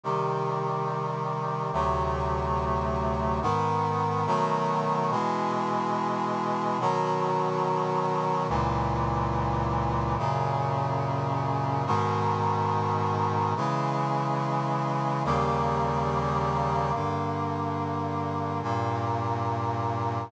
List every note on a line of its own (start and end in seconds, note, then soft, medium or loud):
0.04 1.71 C3 medium
0.04 1.71 D#3 medium
0.04 1.71 G3 medium
1.73 3.40 D2 medium
1.73 3.40 C3 medium
1.73 3.40 F#3 medium
1.73 3.40 A3 medium
3.42 4.26 G#2 medium
3.42 4.26 D#3 loud
3.42 4.26 B3 loud
4.26 5.10 B2 loud
4.26 5.10 D#3 loud
4.26 5.10 F#3 loud
4.26 5.10 A3 medium
5.11 6.78 B2 loud
5.11 6.78 E3 medium
5.11 6.78 G#3 loud
6.80 8.47 B2 loud
6.80 8.47 D#3 loud
6.80 8.47 F#3 loud
8.49 10.16 C#2 loud
8.49 10.16 A#2 loud
8.49 10.16 E3 loud
10.18 11.85 F#2 loud
10.18 11.85 A#2 medium
10.18 11.85 C#3 loud
11.86 13.54 G#2 loud
11.86 13.54 B2 loud
11.86 13.54 D#3 loud
13.56 15.23 C#3 loud
13.56 15.23 E3 loud
13.56 15.23 G#3 medium
15.25 16.92 D#2 loud
15.25 16.92 C#3 loud
15.25 16.92 G3 loud
15.25 16.92 A#3 loud
16.94 18.61 G2 medium
16.94 18.61 D3 medium
16.94 18.61 A#3 medium
18.63 20.30 G2 medium
18.63 20.30 A#2 loud
18.63 20.30 A#3 medium